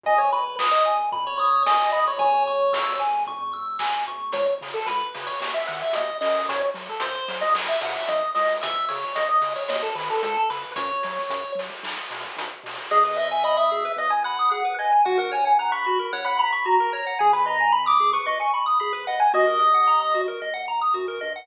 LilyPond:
<<
  \new Staff \with { instrumentName = "Lead 1 (square)" } { \time 4/4 \key gis \minor \tempo 4 = 112 dis''16 cis''16 b'8 r16 dis''8 r8 cis''16 cis''8 dis''8 dis''16 cis''16 | cis''4. r2 r8 | \key cis \minor cis''16 r8 a'16 b'8. cis''16 r16 e''16 fis''16 e''16 dis''8 dis''8 | cis''16 r8 a'16 bis'8. dis''16 r16 e''16 fis''16 e''16 dis''8 dis''8 |
e''8 cis''8 dis''16 dis''8 cis''16 dis''16 a'16 b'16 a'16 a'16 a'16 b'8 | cis''4. r2 r8 | \key gis \minor dis''16 dis''16 e''16 e''16 dis''16 e''8. dis''16 gis''16 fis''8 fis''8 gis''8 | fis''16 fis''16 gis''16 gis''16 fis''16 b''8. fis''16 b''16 b''8 ais''8 ais''8 |
gis''16 b''16 ais''8 b''16 d'''8 cis'''16 r16 cis'''16 r8 b''8 fis''16 gis''16 | dis''2 r2 | }
  \new Staff \with { instrumentName = "Lead 1 (square)" } { \time 4/4 \key gis \minor gis''8 b''8 dis'''8 gis''8 b''8 dis'''8 gis''8 b''8 | gis''8 cis'''8 e'''8 gis''8 cis'''8 e'''8 gis''8 cis'''8 | \key cis \minor r1 | r1 |
r1 | r1 | \key gis \minor gis'16 b'16 dis''16 gis''16 b''16 dis'''16 gis'16 b'16 dis''16 gis''16 b''16 dis'''16 gis'16 b'16 dis''16 gis''16 | fis'16 ais'16 cis''16 fis''16 ais''16 cis'''16 fis'16 ais'16 cis''16 fis''16 ais''16 cis'''16 fis'16 ais'16 cis''16 fis''16 |
gis'16 b'16 dis''16 gis''16 b''16 dis'''16 gis'16 b'16 dis''16 gis''16 b''16 dis'''16 gis'16 b'16 dis''16 gis''16 | fis'16 ais'16 dis''16 fis''16 ais''16 dis'''16 fis'16 ais'16 dis''16 fis''16 ais''16 dis'''16 fis'16 ais'16 dis''16 fis''16 | }
  \new Staff \with { instrumentName = "Synth Bass 1" } { \clef bass \time 4/4 \key gis \minor gis,,8 gis,,8 gis,,8 gis,,8 gis,,8 gis,,8 gis,,8 gis,,8 | cis,8 cis,8 cis,8 cis,8 cis,8 cis,8 dis,8 d,8 | \key cis \minor cis,8 cis8 cis,8 cis8 dis,8 dis8 dis,8 fis,8~ | fis,8 fis8 fis,8 fis8 b,,8 b,8 b,,8 cis,8~ |
cis,8 cis8 cis,8 cis8 dis,8 dis8 cis,8 cis8 | fis,8 fis8 fis,8 fis8 b,,8 b,8 b,,8 b,8 | \key gis \minor gis,,2 gis,,2 | ais,,2 ais,,2 |
gis,,2 gis,,2 | dis,2 dis,4 fis,8 g,8 | }
  \new DrumStaff \with { instrumentName = "Drums" } \drummode { \time 4/4 <bd tomfh>8 tomfh8 <hc bd>8 tomfh8 <bd tomfh>8 tomfh8 <bd sn>8 tomfh8 | <bd tomfh>8 tomfh8 <bd sn>8 tomfh8 <bd tomfh>8 tomfh8 <hc bd>8 tomfh8 | <hh bd>8 hho8 <hh bd>8 hho8 <bd sn>8 hho8 <hh bd>8 hho8 | <hh bd>8 hho8 <hh bd>8 hho8 <hc bd>8 hho8 <hh bd>8 hho8 |
<hh bd>8 hho8 <hh bd>8 hho8 <bd sn>8 hho8 <hh bd>8 hho8 | <hh bd>8 hho8 <hh bd>8 hho8 <hc bd>8 hho8 <hh bd>8 hho8 | r4 r4 r4 r4 | r4 r4 r4 r4 |
r4 r4 r4 r4 | r4 r4 r4 r4 | }
>>